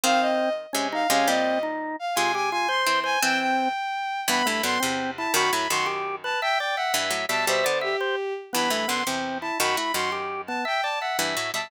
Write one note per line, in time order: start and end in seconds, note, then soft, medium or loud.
0.04 0.67 D#3 medium
0.04 0.67 C4 loud
0.04 0.49 C4 medium
0.04 0.20 F5 loud
0.21 0.53 D#5 loud
0.73 1.04 C3 medium
0.73 1.04 G#3 medium
0.73 0.88 C#4 medium
0.93 1.07 D#4 medium
0.93 1.10 F5 loud
1.10 1.27 C3 medium
1.10 1.27 G#3 loud
1.10 1.28 C#4 medium
1.10 1.28 F5 loud
1.28 1.96 A#2 medium
1.28 1.96 G3 medium
1.28 1.59 C4 medium
1.28 1.61 D#5 loud
1.63 1.96 D#4 medium
1.99 2.15 F5 medium
2.15 2.85 C3 medium
2.15 2.85 G#3 medium
2.15 2.32 F4 medium
2.15 2.32 G#5 loud
2.35 2.50 G4 medium
2.35 2.49 G#5 medium
2.51 2.68 F4 medium
2.51 2.68 G#5 loud
2.69 3.00 C5 medium
2.69 2.98 C6 medium
2.87 3.17 E3 medium
2.87 3.17 C4 medium
3.04 3.19 C5 medium
3.04 3.20 G#5 loud
3.22 3.73 E3 medium
3.22 3.69 C4 medium
3.22 3.73 C4 loud
3.22 3.38 G5 loud
3.41 4.20 G5 medium
4.28 4.43 G2 medium
4.28 4.43 E3 loud
4.28 4.47 B3 medium
4.28 4.46 B5 loud
4.46 4.62 G2 medium
4.46 4.62 E3 medium
4.46 4.62 A3 medium
4.46 4.62 B5 medium
4.63 4.78 F#2 medium
4.63 4.78 D3 medium
4.63 4.79 B3 medium
4.63 4.79 C6 medium
4.80 5.27 E2 medium
4.80 5.27 C3 medium
4.80 5.11 C4 medium
5.17 5.34 E4 medium
5.17 5.32 A5 medium
5.34 5.51 F#2 medium
5.34 5.51 D#3 loud
5.34 5.52 F#4 medium
5.34 5.49 B5 medium
5.53 5.68 A2 medium
5.53 5.68 F#3 medium
5.53 5.68 E4 medium
5.53 5.67 B5 medium
5.69 6.35 F#2 medium
5.69 6.35 D#3 medium
5.69 5.87 F#4 medium
5.69 5.85 C6 medium
5.86 6.16 G4 medium
6.24 6.40 B4 medium
6.24 6.38 A5 medium
6.42 6.58 E5 medium
6.42 6.58 G5 loud
6.58 6.76 D5 medium
6.58 6.75 G5 medium
6.76 6.93 E5 medium
6.76 6.93 F#5 medium
6.94 7.11 G2 medium
6.94 7.11 E3 medium
6.94 7.25 E5 medium
7.11 7.26 A2 medium
7.11 7.26 F#3 medium
7.29 7.46 B2 medium
7.29 7.46 G3 medium
7.29 7.45 E5 medium
7.29 7.45 A5 medium
7.47 7.64 B2 medium
7.47 7.64 G3 medium
7.47 7.78 C5 loud
7.47 7.65 E5 medium
7.64 7.95 D3 medium
7.64 7.95 B3 medium
7.64 7.79 D5 medium
7.81 8.33 G4 medium
7.81 7.97 E5 medium
8.01 8.16 C5 medium
8.53 8.69 G2 medium
8.53 8.69 E3 medium
8.53 8.70 B3 medium
8.53 8.70 B5 medium
8.70 8.86 G2 medium
8.70 8.86 E3 medium
8.70 8.87 A3 medium
8.70 8.86 B5 medium
8.88 9.04 F#2 medium
8.88 9.04 D3 medium
8.88 9.03 B3 medium
8.88 9.02 C6 medium
9.07 9.51 E2 medium
9.07 9.51 C3 medium
9.07 9.38 C4 medium
9.41 9.58 E4 medium
9.41 9.55 A5 medium
9.60 9.77 F#2 medium
9.60 9.77 D#3 medium
9.60 9.76 F#4 medium
9.60 9.75 B5 medium
9.77 9.93 A3 medium
9.77 9.92 E4 medium
9.77 9.93 F#4 medium
9.77 9.92 B5 medium
9.94 10.59 F#2 medium
9.94 10.59 D#3 medium
9.94 10.10 F#4 medium
9.94 10.11 C6 medium
10.12 10.42 G4 medium
10.47 10.65 B3 medium
10.47 10.62 A5 medium
10.65 10.81 E5 medium
10.65 10.84 G5 medium
10.83 10.99 D5 medium
10.83 10.99 A5 medium
11.00 11.17 E5 medium
11.00 11.17 F#5 medium
11.19 11.36 G2 medium
11.19 11.36 E3 medium
11.19 11.51 E5 medium
11.37 11.52 A2 medium
11.37 11.52 F#3 medium
11.54 11.71 B2 medium
11.54 11.71 G3 medium
11.54 11.71 E5 medium
11.54 11.71 A5 medium